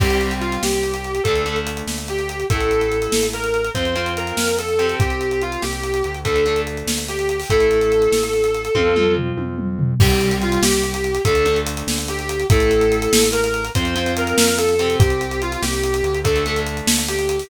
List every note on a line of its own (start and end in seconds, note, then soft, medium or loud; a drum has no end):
0.00 0.58 C2 medium
0.00 1.15 G3 loud
0.00 1.15 C4 loud
0.00 0.34 G4 loud
0.00 kick loud
0.00 crash medium
0.10 closed hi-hat medium
0.21 closed hi-hat medium
0.31 closed hi-hat medium
0.40 0.60 F4 medium
0.40 closed hi-hat medium
0.52 closed hi-hat medium
0.63 1.20 C2 medium
0.63 1.21 G4 medium
0.63 snare medium
0.73 closed hi-hat medium
0.83 closed hi-hat medium
0.94 closed hi-hat medium
1.04 closed hi-hat medium
1.15 closed hi-hat medium
1.24 1.82 D2 medium
1.24 1.44 A3 loud
1.24 1.44 D4 loud
1.24 1.57 A4 loud
1.24 kick medium
1.24 closed hi-hat medium
1.36 closed hi-hat medium
1.46 2.41 A3 medium
1.46 2.41 D4 medium
1.46 closed hi-hat medium
1.56 closed hi-hat medium
1.67 closed hi-hat medium
1.77 closed hi-hat medium
1.87 2.44 D2 medium
1.87 snare medium
1.98 closed hi-hat medium
2.08 2.45 G4 medium
2.08 closed hi-hat medium
2.19 closed hi-hat medium
2.29 closed hi-hat medium
2.40 closed hi-hat medium
2.50 3.08 A1 medium
2.50 3.65 A3 medium
2.50 3.65 E4 loud
2.50 3.26 A4 loud
2.50 kick medium
2.50 closed hi-hat medium
2.61 closed hi-hat medium
2.71 closed hi-hat medium
2.81 closed hi-hat medium
2.92 closed hi-hat medium
3.02 closed hi-hat medium
3.12 3.70 A1 medium
3.12 snare medium
3.23 closed hi-hat medium
3.33 3.69 A#4 medium
3.33 closed hi-hat medium
3.44 closed hi-hat medium
3.54 closed hi-hat medium
3.64 closed hi-hat medium
3.74 4.33 F2 medium
3.74 3.94 C4 loud
3.74 3.94 F4 loud
3.74 4.12 C5 medium
3.74 kick medium
3.74 closed hi-hat medium
3.85 closed hi-hat medium
3.95 4.75 C4 loud
3.95 4.75 F4 loud
3.95 closed hi-hat medium
4.06 closed hi-hat medium
4.17 4.55 A#4 loud
4.17 closed hi-hat medium
4.27 closed hi-hat medium
4.37 4.95 F2 medium
4.37 snare medium
4.48 closed hi-hat medium
4.59 4.96 A4 medium
4.59 closed hi-hat medium
4.68 closed hi-hat medium
4.79 6.15 C4 loud
4.79 6.15 G4 loud
4.79 closed hi-hat medium
4.89 closed hi-hat medium
5.00 5.57 C2 medium
5.00 5.41 G4 loud
5.00 kick loud
5.00 closed hi-hat medium
5.10 closed hi-hat medium
5.21 closed hi-hat medium
5.31 closed hi-hat medium
5.41 5.62 F4 medium
5.41 closed hi-hat medium
5.52 closed hi-hat medium
5.62 6.03 C2 medium
5.62 6.17 G4 loud
5.62 snare medium
5.73 closed hi-hat medium
5.83 closed hi-hat medium
5.94 closed hi-hat medium
6.04 6.83 D2 medium
6.04 closed hi-hat medium
6.14 closed hi-hat medium
6.25 6.44 A3 loud
6.25 6.44 D4 loud
6.25 6.60 A4 medium
6.25 kick medium
6.25 closed hi-hat medium
6.36 closed hi-hat medium
6.45 7.41 A3 medium
6.45 7.41 D4 medium
6.45 closed hi-hat medium
6.56 closed hi-hat medium
6.67 closed hi-hat medium
6.77 closed hi-hat medium
6.87 7.44 D2 medium
6.87 snare medium
6.98 closed hi-hat medium
7.08 7.49 G4 medium
7.08 closed hi-hat medium
7.19 closed hi-hat medium
7.29 closed hi-hat medium
7.40 open hi-hat medium
7.50 8.08 A1 medium
7.50 8.65 A3 loud
7.50 8.65 E4 loud
7.50 9.13 A4 loud
7.50 kick medium
7.50 closed hi-hat medium
7.60 closed hi-hat medium
7.71 closed hi-hat medium
7.81 closed hi-hat medium
7.92 closed hi-hat medium
8.02 closed hi-hat medium
8.12 8.69 A1 medium
8.12 snare medium
8.23 closed hi-hat medium
8.33 closed hi-hat medium
8.44 closed hi-hat medium
8.54 closed hi-hat medium
8.65 closed hi-hat medium
8.75 9.33 F2 medium
8.75 8.94 C4 loud
8.75 8.94 F4 loud
8.75 kick medium
8.75 high tom medium
8.96 9.92 C4 loud
8.96 9.92 F4 medium
8.96 mid tom medium
9.17 floor tom medium
9.37 9.95 F2 medium
9.37 high tom medium
9.58 mid tom medium
9.79 floor tom medium
10.00 10.58 C2 loud
10.00 11.15 G3 loud
10.00 11.15 C4 loud
10.00 10.34 G4 loud
10.00 kick loud
10.00 crash loud
10.10 closed hi-hat medium
10.21 closed hi-hat medium
10.31 closed hi-hat medium
10.42 10.62 F4 loud
10.42 closed hi-hat medium
10.52 closed hi-hat medium
10.62 11.19 C2 medium
10.62 11.20 G4 loud
10.62 snare loud
10.73 closed hi-hat medium
10.83 closed hi-hat medium
10.94 closed hi-hat medium
11.04 closed hi-hat medium
11.15 closed hi-hat medium
11.25 11.83 D2 loud
11.25 11.44 A3 loud
11.25 11.44 D4 loud
11.25 11.58 A4 loud
11.25 kick medium
11.25 closed hi-hat medium
11.35 closed hi-hat medium
11.45 12.41 A3 loud
11.45 12.41 D4 loud
11.45 closed hi-hat medium
11.56 closed hi-hat medium
11.66 closed hi-hat loud
11.77 closed hi-hat medium
11.87 12.45 D2 medium
11.87 snare medium
11.98 closed hi-hat medium
12.08 12.45 G4 loud
12.08 closed hi-hat medium
12.19 closed hi-hat medium
12.29 closed hi-hat medium
12.40 closed hi-hat medium
12.50 13.07 A1 loud
12.50 13.65 A3 loud
12.50 13.65 E4 loud
12.50 13.27 A4 loud
12.50 kick loud
12.50 closed hi-hat loud
12.60 closed hi-hat medium
12.71 closed hi-hat medium
12.81 closed hi-hat medium
12.92 closed hi-hat medium
13.02 closed hi-hat medium
13.12 13.70 A1 medium
13.12 snare loud
13.23 closed hi-hat medium
13.32 13.68 A#4 loud
13.32 closed hi-hat medium
13.44 closed hi-hat medium
13.54 closed hi-hat medium
13.65 closed hi-hat medium
13.75 14.34 F2 loud
13.75 13.94 C4 loud
13.75 13.94 F4 loud
13.75 14.13 C5 loud
13.75 kick medium
13.75 closed hi-hat medium
13.85 closed hi-hat medium
13.95 14.75 C4 loud
13.95 14.75 F4 loud
13.95 closed hi-hat medium
14.06 closed hi-hat medium
14.17 14.56 A#4 loud
14.17 closed hi-hat medium
14.27 closed hi-hat medium
14.38 14.96 F2 medium
14.38 snare loud
14.48 closed hi-hat medium
14.58 14.95 A4 loud
14.58 closed hi-hat medium
14.69 closed hi-hat medium
14.79 16.15 C4 loud
14.79 16.15 G4 loud
14.79 closed hi-hat medium
14.90 closed hi-hat medium
14.99 15.57 C2 medium
14.99 15.40 G4 loud
14.99 kick loud
14.99 closed hi-hat medium
15.10 closed hi-hat medium
15.21 closed hi-hat medium
15.31 closed hi-hat medium
15.42 15.62 F4 loud
15.42 closed hi-hat medium
15.52 closed hi-hat medium
15.62 16.02 C2 loud
15.62 16.17 G4 loud
15.62 snare medium
15.73 closed hi-hat medium
15.84 closed hi-hat medium
15.94 closed hi-hat medium
16.03 16.82 D2 loud
16.03 closed hi-hat medium
16.14 closed hi-hat medium
16.24 16.44 A3 loud
16.24 16.44 D4 loud
16.24 16.58 A4 loud
16.24 kick medium
16.24 closed hi-hat medium
16.36 closed hi-hat medium
16.46 17.42 A3 loud
16.46 17.42 D4 loud
16.46 closed hi-hat medium
16.56 closed hi-hat medium
16.66 closed hi-hat medium
16.77 closed hi-hat medium
16.87 17.44 D2 medium
16.87 snare loud
16.98 closed hi-hat medium
17.08 17.48 G4 loud
17.08 closed hi-hat medium
17.19 closed hi-hat medium
17.29 closed hi-hat medium
17.39 open hi-hat medium